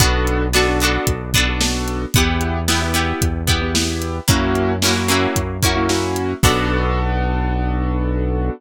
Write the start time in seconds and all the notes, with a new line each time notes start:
0.00 B1 B3 D4 F#4 A4, kick, closed hi-hat
0.27 closed hi-hat
0.53 B3 D4 F#4 A4, snare
0.68 B3 D4 F#4 A4
0.80 B3 D4 F#4, closed hi-hat
0.85 A4
1.07 B1, kick, closed hi-hat
1.34 B3 D4 F#4 A4, kick, closed hi-hat
1.48 B3 D4 F#4 A4
1.60 B3 D4 F#4 A4, snare
1.88 closed hi-hat
2.14 E2 B3 E4 G4, kick, closed hi-hat
2.41 closed hi-hat
2.68 B3 E4 G4, snare
2.82 B3 E4 G4
2.94 B3 E4 G4, closed hi-hat
3.22 E2, kick, closed hi-hat
3.47 B3 E4 G4, kick, closed hi-hat
3.61 B3 E4 G4
3.74 B3 E4 G4, snare
4.02 closed hi-hat
4.28 F#2 A#3 C#4 E4 F#4, kick, closed hi-hat
4.55 closed hi-hat
4.82 A#3 C#4 E4 F#4, snare
4.87 F#4
4.96 A#3 C#4 E4 F#4
5.08 A#3 C#4 E4 F#4, closed hi-hat
5.36 F#2, kick, closed hi-hat
5.62 A#3 C#4 E4 F#4, kick, closed hi-hat
5.75 A#3 C#4 E4 F#4
5.89 A#3 C#4 E4 F#4, snare
6.16 closed hi-hat
6.43 B1 B3 D4 F#4 A4, kick, crash